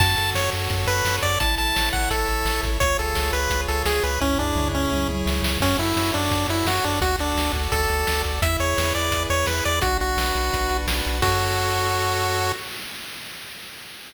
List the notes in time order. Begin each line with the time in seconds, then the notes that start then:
0.00 F#2 F#4 A5, kick, crash
0.17 F#2 A4, closed hi-hat
0.35 F#2 C#5, snare
0.52 F#2 A4, closed hi-hat
0.70 F#2 F#4, kick, closed hi-hat
0.87 F#2 A4 B4, closed hi-hat
1.05 F#2 C#5, snare
1.22 F#2 A4 D5, kick, closed hi-hat
1.40 A1 E4 A5, kick, closed hi-hat
1.57 A1 A4 A5, closed hi-hat
1.75 A1 C#5, snare
1.92 A1 A4 F#5, kick, snare
2.10 A1 E4 A4, kick, closed hi-hat
2.28 A1 A4, closed hi-hat
2.45 A1 C#5, snare
2.63 A1 A4, kick, closed hi-hat
2.80 C#2 F4 C#5, kick, closed hi-hat
2.98 C#2 G#4 A4, closed hi-hat
3.15 C#2 C#5, snare
3.32 C#2 G#4 B4, closed hi-hat
3.50 C#2 F4, kick, closed hi-hat
3.68 C#2 G#4 A4, closed hi-hat
3.85 C#2 G#4 C#5, snare
4.03 C#2 G#4 B4, closed hi-hat
4.20 C#2 C#4 E4, kick, floor tom
4.39 C#2 D4 G#4, floor tom
4.55 C#2 C#5, mid tom
4.73 C#2 C#4 G#4
4.92 C#2 E4, high tom
5.09 C#2 G#4, high tom
5.26 C#2 C#5, snare
5.43 C#2 G#4, snare
5.60 F#2 C#4 F#4, kick, crash
5.79 F#2 E4 A4, closed hi-hat
5.96 F#2 C#5, snare
6.14 F#2 D4 A4, closed hi-hat
6.31 F#2 F#4, kick, closed hi-hat
6.48 F#2 E4 A4, closed hi-hat
6.65 F#2 F#4 C#5, snare
6.84 F#2 D4 A4, kick, closed hi-hat
7.01 D2 F#4, kick, closed hi-hat
7.19 D2 D4 A4, closed hi-hat
7.36 D2 D5, snare
7.53 D2 A4, kick, closed hi-hat
7.72 D2 F#4 A4, kick, closed hi-hat
7.89 D2 A4, closed hi-hat
8.07 D2 D5, snare
8.24 D2 A4, kick, closed hi-hat
8.42 E2 E4 E5, kick, closed hi-hat
8.60 E2 G#4 C#5, closed hi-hat
8.77 E2 B4, snare
8.95 E2 G#4 D5, closed hi-hat
9.12 E2 E4, kick, closed hi-hat
9.30 E2 G#4 C#5, closed hi-hat
9.46 E2 B4, snare
9.65 E2 G#4 D5, closed hi-hat
9.82 B1 D4 F#4, kick, closed hi-hat
10.00 B1 F#4, closed hi-hat
10.17 B1 B4, snare
10.35 B1 F#4, closed hi-hat
10.52 B1 D4, kick, closed hi-hat
10.69 B1 F#4, closed hi-hat
10.87 B1 B4, snare
11.05 B1 F#4, closed hi-hat
11.22 F#2 F#4 A4 C#5, kick, crash